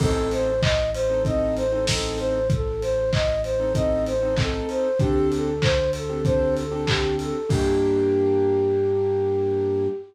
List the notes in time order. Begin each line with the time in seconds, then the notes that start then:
0.00 A1 C4 D#4 A4, kick, crash
0.31 C5, open hi-hat
0.61 D#5, kick, clap
0.94 C5, open hi-hat
1.10 C4 D#4 A4
1.25 C4 D#4 A4 D#5, kick, closed hi-hat
1.56 C5, open hi-hat
1.72 C4 D#4 A4
1.87 C4 D#4 A4, kick, snare
2.18 C5, open hi-hat
2.50 A4, kick, closed hi-hat
2.82 C5, open hi-hat
3.12 D#5, kick, clap
3.43 C5, open hi-hat
3.60 C4 D#4 A4
3.75 C4 D#4 A4 D#5, kick, closed hi-hat
4.06 C5, open hi-hat
4.22 C4 D#4 A4
4.36 C4 D#4 A4, kick, clap
4.69 C5, open hi-hat
4.99 D2 C4 D4 G4 A4, kick, closed hi-hat
5.32 A4, open hi-hat
5.62 C5, kick, clap
5.92 A4, open hi-hat
6.10 C4 D4 G4 A4
6.25 C4 D4 G4 A4 C5, kick, closed hi-hat
6.57 A4, open hi-hat
6.71 C4 D4 G4 A4
6.87 C4 D4 G4 A4, kick, clap
7.18 A4, open hi-hat
7.49 G2 A#3 D4 G4, kick, crash